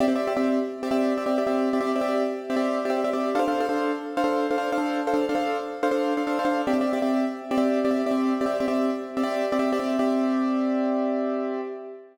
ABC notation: X:1
M:12/8
L:1/16
Q:3/8=144
K:Cmix
V:1 name="Acoustic Grand Piano"
[CGde] [CGde] [CGde]2 [CGde] [CGde]7 [CGde] [CGde]4 [CGde] [CGde]2 [CGde] [CGde]3- | [CGde] [CGde] [CGde]2 [CGde] [CGde]7 [CGde] [CGde]4 [CGde] [CGde]2 [CGde] [CGde]3 | [DAcf] [DAcf] [DAcf]2 [DAcf] [DAcf]7 [DAcf] [DAcf]4 [DAcf] [DAcf]2 [DAcf] [DAcf]3- | [DAcf] [DAcf] [DAcf]2 [DAcf] [DAcf]7 [DAcf] [DAcf]4 [DAcf] [DAcf]2 [DAcf] [DAcf]3 |
[CGde] [CGde] [CGde]2 [CGde] [CGde]7 [CGde] [CGde]4 [CGde] [CGde]2 [CGde] [CGde]3- | [CGde] [CGde] [CGde]2 [CGde] [CGde]7 [CGde] [CGde]4 [CGde] [CGde]2 [CGde] [CGde]3 | [CGde]24 |]